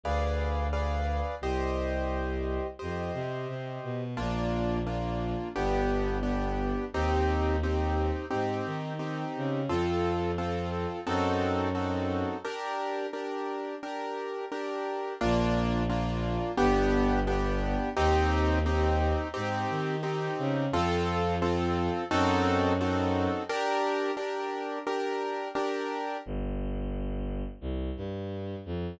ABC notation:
X:1
M:4/4
L:1/8
Q:1/4=87
K:Bb
V:1 name="Acoustic Grand Piano"
[_A=Bdf]2 [ABdf]2 | [Gce]4 [Gce]4 | [B,DF]2 [B,DF]2 [=B,DG]2 [B,DG]2 | [CEG]2 [CEG]2 [CEG]2 [CEG]2 |
[CFA]2 [CFA]2 [CE^FA]2 [CEFA]2 | [DGB]2 [DGB]2 [DGB]2 [DGB]2 | [B,DF]2 [B,DF]2 [=B,DG]2 [B,DG]2 | [CEG]2 [CEG]2 [CEG]2 [CEG]2 |
[CFA]2 [CFA]2 [CE^FA]2 [CEFA]2 | [DGB]2 [DGB]2 [DGB]2 [DGB]2 | [K:Gm] z8 |]
V:2 name="Violin" clef=bass
D,,4 | C,,4 F,, C, C, =B,, | B,,,4 G,,,4 | E,,4 _A,, E,2 _D, |
F,,4 ^F,,4 | z8 | B,,,4 G,,,4 | E,,4 _A,, E,2 _D, |
F,,4 ^F,,4 | z8 | [K:Gm] G,,,4 C,, G,,2 F,, |]